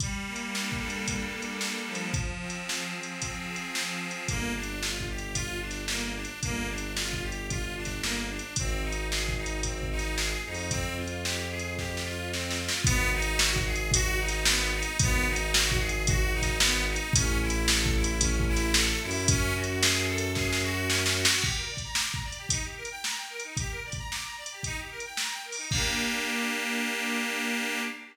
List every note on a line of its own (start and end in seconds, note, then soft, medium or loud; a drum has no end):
0.00 1.06 G3 medium
0.00 kick loud
0.00 closed hi-hat loud
0.27 1.33 A#3 medium
0.36 closed hi-hat medium
0.53 1.60 D4 medium
0.53 snare medium
0.72 kick medium
0.79 2.06 A4 medium
0.90 closed hi-hat medium
1.07 2.09 G3 medium
1.07 kick medium
1.07 closed hi-hat loud
1.33 2.10 A#3 medium
1.42 closed hi-hat medium
1.60 2.11 D4 medium
1.60 snare medium
1.88 2.94 F3 medium
1.95 closed hi-hat medium
2.14 kick loud
2.14 closed hi-hat medium
2.42 3.22 C4 medium
2.50 closed hi-hat medium
2.69 3.49 G#4 soft
2.69 snare loud
2.94 3.74 F3 medium
3.03 closed hi-hat medium
3.22 4.00 C4 medium
3.22 kick medium
3.22 closed hi-hat medium
3.49 4.25 G#4 medium
3.56 closed hi-hat medium
3.75 4.26 F3 medium
3.75 snare loud
4.00 4.26 C4 medium
4.11 closed hi-hat medium
4.28 6.26 G1 medium
4.28 4.53 A#3 loud
4.28 kick loud
4.28 closed hi-hat medium
4.56 4.80 D4 medium
4.63 closed hi-hat medium
4.81 5.05 F4 medium
4.81 snare loud
5.00 kick medium
5.10 5.34 G4 medium
5.18 closed hi-hat medium
5.34 5.58 F4 medium
5.34 kick medium
5.34 closed hi-hat loud
5.61 5.85 D4 medium
5.71 snare medium
5.71 closed hi-hat medium
5.88 6.14 A#3 medium
5.88 snare loud
6.16 6.40 D4 medium
6.25 closed hi-hat medium
6.43 8.40 G1 medium
6.43 6.67 A#3 loud
6.43 kick loud
6.43 closed hi-hat medium
6.69 6.93 D4 medium
6.78 closed hi-hat medium
6.97 7.22 F4 medium
6.97 snare loud
7.13 kick medium
7.23 7.47 G4 medium
7.32 closed hi-hat medium
7.50 7.74 F4 medium
7.50 kick medium
7.50 closed hi-hat medium
7.77 8.01 D4 medium
7.85 kick medium
7.85 snare medium
7.85 closed hi-hat medium
8.02 8.26 A#3 medium
8.02 snare loud
8.29 8.54 D4 medium
8.39 closed hi-hat medium
8.56 10.35 G#1 medium
8.56 8.82 C4 medium
8.56 kick loud
8.56 closed hi-hat loud
8.83 9.07 D#4 medium
8.92 closed hi-hat medium
9.11 9.35 G#4 medium
9.11 snare loud
9.29 kick medium
9.37 9.61 D#4 medium
9.46 closed hi-hat medium
9.63 9.88 C4 medium
9.63 kick medium
9.63 closed hi-hat loud
9.83 kick medium
9.91 10.15 D#4 medium
9.99 snare medium
9.99 closed hi-hat medium
10.18 10.43 G#4 medium
10.18 snare loud
10.45 12.69 F2 medium
10.45 10.70 D#4 medium
10.54 open hi-hat medium
10.70 10.95 C4 loud
10.70 kick loud
10.70 closed hi-hat loud
10.98 11.22 F4 medium
11.07 closed hi-hat medium
11.24 11.49 G4 medium
11.24 snare loud
11.50 11.74 G#4 medium
11.59 closed hi-hat medium
11.78 12.02 G4 medium
11.78 kick medium
11.78 snare medium
11.97 snare medium
12.05 12.29 F4 medium
12.33 12.57 C4 medium
12.33 snare medium
12.50 snare medium
12.60 12.84 F4 medium
12.69 snare loud
12.84 14.83 G#1 medium
12.84 13.09 B3 loud
12.84 kick loud
12.84 closed hi-hat loud
13.14 13.38 D#4 loud
13.22 closed hi-hat medium
13.39 13.63 F#4 medium
13.39 snare loud
13.56 kick loud
13.66 13.90 G#4 medium
13.75 closed hi-hat medium
13.92 14.18 F#4 loud
13.92 kick loud
13.92 closed hi-hat loud
14.19 14.44 D#4 medium
14.28 snare medium
14.28 closed hi-hat medium
14.45 14.71 B3 loud
14.45 snare loud
14.74 14.98 D#4 loud
14.83 closed hi-hat medium
14.99 16.97 G#1 medium
14.99 15.26 B3 loud
14.99 kick loud
14.99 closed hi-hat loud
15.28 15.52 D#4 loud
15.36 closed hi-hat medium
15.54 15.78 F#4 loud
15.54 snare loud
15.72 kick loud
15.80 16.04 G#4 medium
15.89 closed hi-hat medium
16.07 16.32 F#4 loud
16.07 kick loud
16.07 closed hi-hat loud
16.33 16.57 D#4 loud
16.42 kick medium
16.42 snare medium
16.42 closed hi-hat medium
16.59 16.83 B3 loud
16.59 snare loud
16.89 17.13 D#4 medium
16.96 closed hi-hat medium
17.13 18.92 A1 loud
17.13 17.39 C#4 loud
17.13 kick loud
17.13 closed hi-hat loud
17.42 17.66 E4 loud
17.50 closed hi-hat medium
17.68 17.93 A4 medium
17.68 snare loud
17.86 kick loud
17.96 18.20 E4 medium
18.04 closed hi-hat loud
18.21 18.45 C#4 medium
18.21 kick loud
18.21 closed hi-hat loud
18.40 kick loud
18.48 18.72 E4 loud
18.56 snare medium
18.56 closed hi-hat medium
18.74 19.00 A4 loud
18.74 snare loud
19.02 21.26 F#2 loud
19.02 19.27 E4 medium
19.11 open hi-hat medium
19.28 19.54 C#4 loud
19.28 kick loud
19.28 closed hi-hat loud
19.55 19.80 F#4 medium
19.64 closed hi-hat medium
19.82 20.06 G#4 loud
19.82 snare loud
20.07 20.31 A4 loud
20.18 closed hi-hat medium
20.35 20.60 G#4 loud
20.35 kick medium
20.35 snare medium
20.53 snare loud
20.63 20.87 F#4 loud
20.89 21.13 C#4 loud
20.89 snare loud
21.06 snare loud
21.17 21.42 F#4 medium
21.25 snare loud
21.42 21.56 G4 medium
21.42 kick loud
21.42 crash loud
21.56 21.68 A#4 medium
21.69 21.81 D5 medium
21.77 kick medium
21.77 closed hi-hat medium
21.84 21.96 A#5 medium
21.95 22.10 D6 medium
21.95 snare loud
22.11 22.23 A#5 medium
22.11 kick medium
22.25 22.37 D5 medium
22.32 closed hi-hat medium
22.37 22.50 G4 medium
22.49 22.62 D#4 medium
22.49 kick medium
22.49 closed hi-hat loud
22.64 22.76 G4 medium
22.77 22.89 A#4 medium
22.85 closed hi-hat medium
22.91 23.03 G5 medium
23.04 23.16 A#5 medium
23.04 snare loud
23.17 23.29 G5 medium
23.29 23.41 A#4 medium
23.40 closed hi-hat medium
23.44 23.56 D#4 medium
23.57 23.71 G4 medium
23.57 kick loud
23.57 closed hi-hat loud
23.71 23.83 A#4 medium
23.85 23.97 D5 medium
23.92 kick medium
23.92 closed hi-hat medium
23.98 24.10 A#5 medium
24.11 24.23 D6 medium
24.11 snare medium
24.24 24.36 A#5 medium
24.37 24.49 D5 medium
24.46 closed hi-hat medium
24.52 24.64 G4 medium
24.63 24.77 D#4 medium
24.63 kick medium
24.63 closed hi-hat medium
24.78 24.90 G4 medium
24.91 25.03 A#4 medium
25.00 closed hi-hat medium
25.05 25.17 G5 medium
25.17 25.31 A#5 medium
25.17 snare loud
25.31 25.44 G5 medium
25.45 25.57 A#4 medium
25.52 open hi-hat medium
25.58 25.70 D#4 medium
25.71 27.81 A#3 loud
25.71 27.81 D4 medium
25.71 kick loud
25.71 crash loud
25.75 27.81 G4 medium